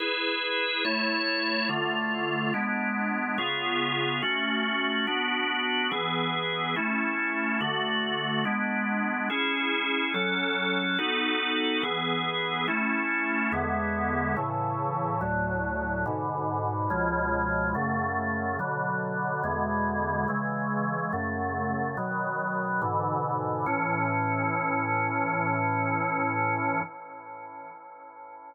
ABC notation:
X:1
M:4/4
L:1/8
Q:1/4=71
K:A
V:1 name="Drawbar Organ"
[EGB]2 [A,Ec]2 [D,A,=F]2 [G,B,D]2 | [C,B,^EG]2 [A,CF]2 [B,DF]2 [=E,B,G]2 | [A,CE]2 [D,A,F]2 [G,B,D]2 [CEG]2 | [F,CA]2 [B,^DFA]2 [E,B,G]2 [A,CE]2 |
[E,,D,G,B,]2 [A,,C,E,]2 [D,,A,,F,]2 [G,,B,,D,]2 | [C,,B,,^E,G,]2 [F,,C,A,]2 [B,,D,F,]2 [=E,,B,,D,G,]2 | [C,E,G,]2 [F,,C,A,]2 [B,,^D,F,]2 [G,,B,,=D,E,]2 | [A,,E,C]8 |]